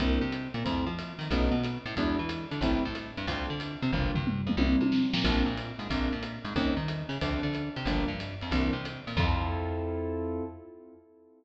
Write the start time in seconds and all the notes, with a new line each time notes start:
0.00 C2 A#3 C4 D4 E4, kick, ride
0.21 C3 C4
0.32 hi-hat pedal, ride
0.54 A#2 A#3, ride
0.64 F2 A3 C4 E4 F4, kick, ride
0.87 F3 F4
0.99 hi-hat pedal, ride
1.19 D#3 D#4, ride
1.31 B1 A3 B3 C#4 D#4, kick, ride
1.52 B2 B3
1.64 hi-hat pedal, ride
1.86 A2 A3, ride
1.96 E2 F#3 G#3 D4 E4, kick, ride
2.18 E3 E4
2.29 hi-hat pedal, ride
2.51 D3 D4, ride
2.61 A1 G3 A3 C4 E4, kick, ride
2.84 A2 A3
2.95 hi-hat pedal, ride
3.17 G2 G3, ride
3.27 D2 A3 C4 D4 F4, kick, ride
3.48 D3 D4
3.60 hi-hat pedal, ride
3.82 C3 C4, ride
3.93 G1 G3 A#3 D4 F4, kick, floor tom
4.15 G2 G3, floor tom
4.27 mid tom
4.47 F2 F3, mid tom
4.57 C2 A#3 C4 D4 E4, high tom
4.81 C3 C4, high tom
4.92 snare
5.13 A#2 A#3, snare
5.24 A#1 A#3 C4 D4 F4, kick, crash, ride
5.45 A#2 A#3
5.57 hi-hat pedal, ride
5.79 G#2 G#3, ride
5.90 A#1 G#3 A#3 C4 D4, kick, ride
6.12 A#2 A#3
6.23 hi-hat pedal, ride
6.45 G#2 G#3, ride
6.56 D#2 G3 C4 C#4 D#4, kick, ride
6.77 D#3 D#4
6.88 hi-hat pedal, ride
7.09 C#3 C#4, ride
7.21 D2 F3 A3 C4 D4, kick, ride
7.43 D3 D4
7.54 hi-hat pedal, ride
7.76 C3 C4, ride
7.85 G1 F3 G3 A#3 D4, kick, ride
8.08 G2 G3
8.20 hi-hat pedal, ride
8.41 F2 F3, ride
8.51 C2 E3 A#3 C4 D4, kick, ride
8.73 C3 C4
8.85 hi-hat pedal, ride
9.07 A#2 A#3, ride
9.17 F2 C4 E4 F4 A4, kick, crash